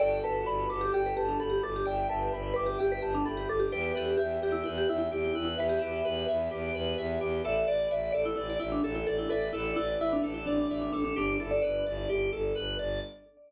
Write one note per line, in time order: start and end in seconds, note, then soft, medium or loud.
0.00 0.20 G1 loud
0.00 1.74 F#4 medium
0.00 1.74 A4 medium
0.00 0.18 D5 loud
0.00 0.21 G5 loud
0.23 0.43 G1 medium
0.23 0.46 B4 loud
0.23 0.44 A5 medium
0.46 0.66 G1 loud
0.46 0.66 B4 medium
0.46 0.67 B5 medium
0.70 0.90 G1 medium
0.70 0.81 B4 medium
0.70 0.91 D6 medium
0.81 0.92 G4 loud
0.93 1.13 G1 medium
0.93 1.05 G4 loud
0.93 1.14 G5 medium
1.06 1.17 B4 loud
1.16 1.36 G1 loud
1.16 1.28 G4 medium
1.16 1.37 A5 medium
1.28 1.39 D4 medium
1.39 1.59 G1 medium
1.39 1.51 A4 loud
1.39 1.61 B5 medium
1.50 1.61 G4 medium
1.63 1.83 G1 medium
1.63 1.75 A4 medium
1.63 1.84 D6 medium
1.76 1.87 G4 medium
1.86 2.06 G1 loud
1.86 2.07 D5 loud
1.86 3.47 E5 medium
1.86 2.07 G5 medium
1.86 3.47 G5 medium
2.09 2.29 G1 loud
2.09 2.30 B4 medium
2.09 2.30 A5 medium
2.32 2.52 G1 loud
2.32 2.53 B4 medium
2.32 2.53 B5 medium
2.54 2.75 G1 medium
2.54 2.65 B4 loud
2.54 2.77 D6 medium
2.66 2.77 G4 medium
2.79 2.99 G1 medium
2.79 2.91 G4 loud
2.79 3.00 G5 medium
2.92 3.03 B4 medium
3.02 3.22 G1 loud
3.02 3.13 G4 medium
3.02 3.23 A5 medium
3.15 3.26 D4 loud
3.25 3.45 G1 medium
3.25 3.37 A4 medium
3.25 3.46 B5 medium
3.37 3.48 G4 medium
3.49 3.68 G1 medium
3.49 3.60 A4 medium
3.49 3.70 D6 medium
3.60 3.71 G4 medium
3.72 3.92 E2 loud
3.72 3.93 G4 loud
3.72 3.94 B4 loud
3.72 5.48 E5 medium
3.72 5.48 G5 medium
3.95 4.15 E2 medium
3.95 4.17 G4 medium
3.95 4.16 B4 medium
4.17 4.38 E2 medium
4.17 4.36 G4 loud
4.17 4.40 E5 medium
4.42 4.62 E2 medium
4.42 4.63 G4 medium
4.42 4.54 G4 medium
4.52 4.63 E4 loud
4.64 4.85 E2 loud
4.64 4.75 E4 medium
4.64 4.86 B4 medium
4.78 4.89 G4 medium
4.88 5.08 E2 medium
4.88 4.98 E4 medium
4.88 5.09 E5 medium
4.99 5.10 E4 loud
5.11 5.31 E2 medium
5.11 5.24 E4 medium
5.11 5.32 G4 medium
5.25 5.33 E4 medium
5.34 5.55 E2 loud
5.34 5.44 E4 medium
5.34 5.56 B4 medium
5.45 5.56 E4 medium
5.58 5.78 E2 loud
5.58 7.36 G4 medium
5.58 7.36 B4 medium
5.58 5.71 B4 loud
5.58 5.79 E5 medium
5.69 5.80 G4 medium
5.79 6.01 E2 medium
5.79 6.03 G4 medium
5.79 6.61 E5 loud
6.05 6.25 E2 loud
6.05 6.25 B4 medium
6.28 6.48 E2 loud
6.28 6.49 E5 medium
6.51 6.71 E2 medium
6.51 6.72 G4 medium
6.74 6.94 E2 loud
6.74 6.96 B4 medium
6.98 7.17 E2 loud
6.98 7.19 E5 medium
7.21 7.41 E2 loud
7.21 7.42 G4 medium
7.44 7.64 A1 loud
7.44 7.66 A4 loud
7.44 8.48 B4 medium
7.44 8.48 D5 medium
7.44 7.68 E5 loud
7.67 7.87 A1 medium
7.67 7.88 D5 medium
7.67 7.90 D5 medium
7.91 8.10 A1 medium
7.91 8.12 D5 medium
7.91 8.12 E5 medium
8.12 8.34 A1 medium
8.12 8.35 A4 medium
8.12 8.23 D5 loud
8.25 8.35 E4 loud
8.36 8.57 A1 medium
8.36 8.47 E4 medium
8.36 8.58 D5 medium
8.50 8.61 D5 loud
8.60 8.80 A1 loud
8.60 8.71 E4 loud
8.60 8.81 E5 medium
8.72 8.83 D4 loud
8.84 9.03 A1 loud
8.84 8.95 A4 loud
8.84 9.05 A4 medium
8.95 9.06 E4 loud
9.07 9.27 A1 medium
9.07 9.18 A4 medium
9.07 9.28 D5 medium
9.18 9.29 E4 medium
9.29 9.50 A1 medium
9.29 9.49 A4 loud
9.29 10.87 B4 medium
9.29 10.87 D5 medium
9.29 9.51 E5 medium
9.53 9.73 A1 loud
9.53 9.72 E4 medium
9.53 9.75 A4 medium
9.76 9.97 A1 medium
9.76 9.99 E4 loud
9.76 9.97 D5 medium
10.00 10.20 A1 medium
10.00 10.12 E4 loud
10.00 10.21 E5 medium
10.13 10.21 D4 medium
10.22 10.43 A1 medium
10.22 10.33 D4 medium
10.22 10.44 A4 medium
10.34 10.45 E4 medium
10.46 10.66 A1 loud
10.46 10.57 D4 loud
10.46 10.68 D5 medium
10.57 10.68 D4 medium
10.70 10.89 A1 medium
10.70 10.81 D4 medium
10.70 10.91 E5 medium
10.82 10.92 D4 medium
10.93 11.13 A1 medium
10.93 11.04 D4 loud
10.93 11.14 A4 medium
11.05 11.16 D4 loud
11.16 11.36 G1 loud
11.16 11.37 D4 loud
11.16 11.40 D4 medium
11.16 11.37 G4 loud
11.40 11.59 G1 loud
11.40 12.26 E4 medium
11.40 11.61 A4 medium
11.40 11.51 A4 medium
11.51 11.61 D5 medium
11.62 11.82 G1 medium
11.62 11.83 B4 medium
11.62 12.20 D5 medium
11.86 12.06 G1 loud
11.86 12.07 D5 medium
12.09 12.29 G1 loud
12.09 12.30 G4 medium
12.33 12.52 G1 medium
12.33 12.53 A4 medium
12.55 12.76 G1 medium
12.55 12.76 B4 medium
12.79 12.99 G1 medium
12.79 13.00 D5 medium